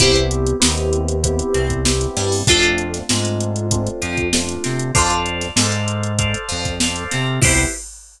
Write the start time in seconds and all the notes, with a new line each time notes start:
0.00 C2 B3 C4 E4 G4 B4 C5, kick, closed hi-hat
0.15 closed hi-hat
0.31 closed hi-hat
0.47 closed hi-hat
0.60 D#2 B3 C4 D#4 E4 G4, snare
0.77 closed hi-hat
0.93 closed hi-hat
1.08 closed hi-hat
1.24 B3 C4 E4 G4, kick, closed hi-hat
1.39 closed hi-hat
1.54 C2 C4, closed hi-hat
1.70 kick, closed hi-hat
1.85 B3 C4 E4 G4, snare
2.01 closed hi-hat
2.17 G2 G3, snare, closed hi-hat
2.32 open hi-hat
2.47 F2 A3 C4 D4 F4 A4, kick, closed hi-hat
2.51 C5
2.63 closed hi-hat
2.78 closed hi-hat
2.94 snare, closed hi-hat
3.09 G#2 G#3 A3 C4 D4 F4, snare
3.25 closed hi-hat
3.40 closed hi-hat
3.56 closed hi-hat
3.71 A3 C4 D4 F4, kick, closed hi-hat
3.87 closed hi-hat
4.02 F2 F3, closed hi-hat
4.17 kick, closed hi-hat
4.33 A3 C4 D4 F4, snare
4.49 closed hi-hat
4.64 C3 C4, snare, closed hi-hat
4.79 closed hi-hat
4.95 F2 D4 F4 A4 C5 D5 F5, kick, closed hi-hat
5.10 closed hi-hat
5.26 closed hi-hat
5.41 snare, closed hi-hat
5.56 G#2 G#3 A4 C5 D5 F5, snare
5.72 closed hi-hat
5.88 closed hi-hat
6.03 closed hi-hat
6.19 A4 C5 D5 F5, kick, closed hi-hat
6.34 closed hi-hat
6.49 F2 F3, closed hi-hat
6.65 kick, snare, closed hi-hat
6.80 A4 C5 D5 F5, snare
6.96 closed hi-hat
7.11 C3 C4, snare, closed hi-hat
7.41 C2 B3 C4 E4 G4 B4 C5, kick, crash